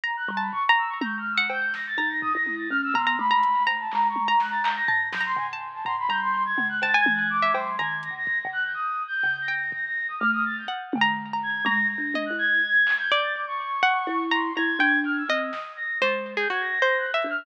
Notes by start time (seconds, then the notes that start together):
0.03 A#5
0.17 F#6
0.28 G3, floor tom
0.37 A5 B5
0.52 C#6, floor tom
0.69 A#5
0.78 E6
0.88 C#6
1.01 A#5 G6, high tom
1.18 F6
1.32 E6
1.37 F#5
1.50 G6, cowbell
1.74 A#6, snare
1.86 A6
1.97 D#4 A#5, floor tom
2.09 A#6
2.21 D#6, floor tom
2.33 E4 A#6
2.46 high tom
2.58 A6
2.70 C#4 F6
2.83 E6
2.94 B3 A#5 C6, floor tom
3.07 A#5
3.19 A3 B5, high tom
3.31 A#5
3.43 closed hi-hat
3.67 A#5, cowbell
3.79 A5
3.92 G#3 A#5, clap
4.08 C#6
4.16 high tom
4.25 A#5
4.40 F#6, snare
4.51 A6
4.63 A#5 G6, clap
4.76 A#6
4.88 A5, floor tom
5.12 F#3 G6, snare
5.20 A#5
5.26 C6
5.36 C#3 G#5, floor tom
5.53 A5
5.73 A5
5.85 C#3 A#5 C6, floor tom
5.99 B5
6.09 G3 A#5 G6
6.21 C6
6.45 G#6
6.58 C#3, high tom
6.69 F#6
6.82 C#3 A5 A6, cowbell
6.94 G#5 G#6
7.06 E3, high tom
7.15 F#6
7.30 D6
7.42 E5
7.54 F#3 C6, cowbell
7.79 D#3 A#5 G#6
8.03 A#6, closed hi-hat
8.10 C#3
8.16 A#6
8.27 kick
8.38 A#6
8.45 C#3
8.52 F#6
8.64 G6
8.74 D#6
9.08 G6
9.23 C#3
9.41 A#6
9.48 G5
9.72 A#6, kick
9.85 A#6
10.08 D#6
10.19 A3 F6
10.32 D#6
10.45 A6
10.57 G6
10.68 F#5
10.93 D3, high tom
11.01 A#5
11.33 A#5
11.43 G#6
11.65 G#3 A#5 A#6, high tom
11.90 A#6
11.98 D4
12.14 D#5, high tom
12.25 F#6
12.30 E4
12.38 G#6
12.87 clap
12.99 G6
13.11 D5
13.22 A6
13.34 D6
13.47 C#6
13.83 F#5
14.07 E4
14.31 A#5 C6
14.56 E4 A#5 G#6
14.79 D4 G5
15.05 F6
15.17 E6
15.29 C4 D#5
15.39 D#6
15.53 snare
15.76 A#6
16.01 G#3 C5 A6
16.37 G#4 G6
16.50 F#4 G#6
16.60 A#6
16.82 C5 A#6
16.97 F#6
17.13 E5 E6
17.22 D4, closed hi-hat
17.30 F6